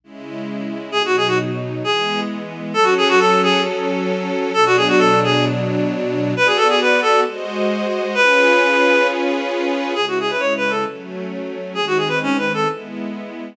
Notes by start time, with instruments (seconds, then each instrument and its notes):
0.04 string ensemble 1 C#3 G#3 E4
0.92 string ensemble 1 B2 F#3 D#4, clarinet G#4
1.05 clarinet F#4
1.17 clarinet G#4
1.27 clarinet F#4
1.84 string ensemble 1 E3 G#3 B3, clarinet G#4
2.74 string ensemble 1 F#3 C#4 A4, clarinet A4
2.83 clarinet F#4
2.97 clarinet G#4
3.09 clarinet F#4
3.19 clarinet A4
3.43 clarinet G#4
4.54 string ensemble 1 B2 F#3 D4, clarinet A4
4.66 clarinet F#4
4.77 clarinet G#4
4.89 clarinet F#4
4.98 clarinet A4
5.24 clarinet G#4
6.35 string ensemble 1 B3 F#4 D5, clarinet B4
6.46 clarinet G#4
6.57 clarinet A4
6.69 clarinet G#4
6.81 clarinet B4
7.02 clarinet A4
7.25 string ensemble 1 G#3 F#4 C5 D#5
8.15 string ensemble 1 C#4 F4 G#4 B4, clarinet B4
9.95 string ensemble 1 C#3 G#3 E4, clarinet G#4
10.08 clarinet F#4
10.20 clarinet G#4
10.30 clarinet B4
10.39 clarinet C#5
10.57 clarinet B4
10.70 clarinet A4
10.86 string ensemble 1 F#3 A3 C#4
11.75 string ensemble 1 D#3 G#3 C4, clarinet G#4
11.87 clarinet F#4
11.97 clarinet G#4
12.08 clarinet B4
12.23 clarinet C#4
12.38 clarinet B4
12.54 clarinet A4
12.66 string ensemble 1 G#3 B3 E4